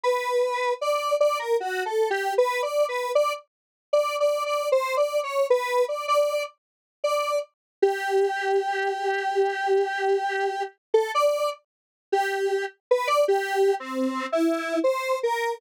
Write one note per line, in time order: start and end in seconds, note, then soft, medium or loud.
0.03 0.74 B4 medium
0.81 1.16 D5 medium
1.20 1.38 D5 loud
1.39 1.57 A#4 medium
1.60 1.84 F#4 medium
1.85 2.09 A4 soft
2.10 2.34 G4 medium
2.38 2.61 B4 loud
2.62 2.86 D5 medium
2.88 3.12 B4 medium
3.15 3.33 D5 loud
3.93 4.16 D5 medium
4.20 4.44 D5 medium
4.46 4.69 D5 medium
4.72 4.95 C5 medium
4.97 5.20 D5 medium
5.23 5.47 C#5 medium
5.50 5.85 B4 loud
5.88 6.06 D5 medium
6.08 6.43 D5 loud
7.04 7.39 D5 medium
7.82 10.63 G4 medium
10.94 11.11 A4 medium
11.14 11.50 D5 loud
12.12 12.65 G4 medium
12.91 13.08 B4 medium
13.07 13.25 D5 loud
13.28 13.75 G4 loud
13.80 14.26 C4 medium
14.32 14.79 E4 medium
14.84 15.19 C5 medium
15.23 15.58 A#4 medium